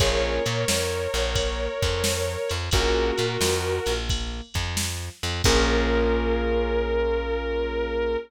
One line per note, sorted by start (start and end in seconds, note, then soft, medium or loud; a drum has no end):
0.00 0.39 A#1 medium
0.00 0.42 A#3 medium
0.00 0.42 C#4 medium
0.00 0.42 F4 medium
0.00 0.42 G#4 medium
0.00 2.52 A#4 medium
0.00 2.52 C#5 medium
0.00 kick loud
0.00 ride loud
0.46 0.65 A#2 medium
0.46 0.65 A#3 medium
0.46 ride medium
0.68 1.07 F2 medium
0.68 1.07 F3 medium
0.68 snare loud
1.14 1.68 A#1 medium
1.14 1.68 A#3 medium
1.14 ride medium
1.35 kick medium
1.35 ride loud
1.82 2.37 F2 medium
1.82 2.37 F3 medium
1.82 kick medium
1.82 ride medium
2.04 snare loud
2.49 2.70 F2 medium
2.49 2.69 F3 medium
2.49 ride medium
2.71 3.12 A#1 medium
2.71 3.14 A#3 medium
2.71 3.14 C#4 medium
2.71 3.14 F4 medium
2.71 3.93 F#4 medium
2.71 3.14 G#4 medium
2.71 3.93 A#4 medium
2.71 kick loud
2.71 ride medium
3.18 3.37 A#2 medium
3.18 3.37 A#3 medium
3.18 ride medium
3.41 3.80 F2 medium
3.41 3.81 F3 medium
3.41 snare loud
3.86 4.41 A#1 medium
3.86 4.41 A#3 medium
3.86 ride medium
4.10 kick medium
4.10 ride medium
4.54 5.10 F2 medium
4.54 5.09 F3 medium
4.54 kick medium
4.54 ride medium
4.77 snare loud
5.23 5.42 F2 medium
5.23 5.42 F3 medium
5.23 ride medium
5.44 8.17 A#1 medium
5.44 8.17 A#3 loud
5.44 8.17 C#4 loud
5.44 8.17 F4 loud
5.44 8.17 G#4 medium
5.44 8.16 A#4 loud
5.44 kick loud
5.44 crash loud